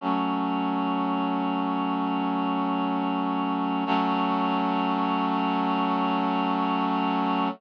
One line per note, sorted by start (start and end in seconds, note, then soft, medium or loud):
0.01 3.84 F#3 medium
0.01 3.84 A3 medium
0.01 3.84 C#4 medium
3.86 7.49 F#3 loud
3.86 7.49 A3 loud
3.86 7.49 C#4 medium